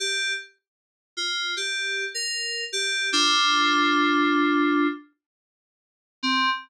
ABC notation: X:1
M:4/4
L:1/16
Q:1/4=77
K:Cm
V:1 name="Electric Piano 2"
G2 z4 F2 G3 B3 G2 | [DF]10 z6 | C4 z12 |]